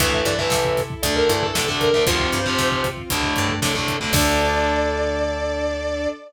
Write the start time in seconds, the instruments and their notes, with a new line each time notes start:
0.00 electric bass (finger) D2, harpsichord E3, overdriven guitar E3 A3, string ensemble 1 E4 A4, distortion guitar E5, kick, closed hi-hat
0.13 kick
0.25 electric bass (finger) G2, harpsichord E3, distortion guitar D5, kick, closed hi-hat
0.39 overdriven guitar E3 A3, distortion guitar E5, kick
0.50 electric bass (finger) C3, kick, snare
0.65 kick
0.77 kick, snare, closed hi-hat
0.90 kick
1.03 electric bass (finger) D2, overdriven guitar D3 A3, string ensemble 1 D4 A4, distortion guitar D5, kick, closed hi-hat
1.16 distortion guitar A#4, kick
1.29 electric bass (finger) G2, harpsichord E3, kick, closed hi-hat
1.42 distortion guitar A4, kick
1.53 electric bass (finger) C3, overdriven guitar D3 A3, distortion guitar A4, kick, snare
1.68 overdriven guitar D3 A3, kick
1.80 distortion guitar A#4, kick, closed hi-hat
1.94 overdriven guitar D3 A3, kick
2.06 electric bass (finger) D2, overdriven guitar C3 F3, harpsichord F3, string ensemble 1 C4 F4, distortion guitar C5, kick, closed hi-hat
2.20 kick
2.32 electric bass (finger) G2, kick, closed hi-hat
2.46 overdriven guitar C3 F3, kick
2.58 electric bass (finger) C3, kick, snare
2.72 kick
2.84 kick, snare, closed hi-hat
2.97 kick
3.10 electric bass (finger) D2, overdriven guitar A2 D3, string ensemble 1 A3 D4, kick, closed hi-hat
3.23 kick
3.36 electric bass (finger) G2, kick, closed hi-hat
3.49 kick
3.62 overdriven guitar A2 D3, electric bass (finger) C3, kick, snare
3.75 overdriven guitar A2 D3, kick
3.88 kick, closed hi-hat
4.00 overdriven guitar A2 D3, kick
4.13 electric bass (finger) D2, overdriven guitar D3 A3, string ensemble 1 D4 A4, harpsichord D4, distortion guitar D5, kick, crash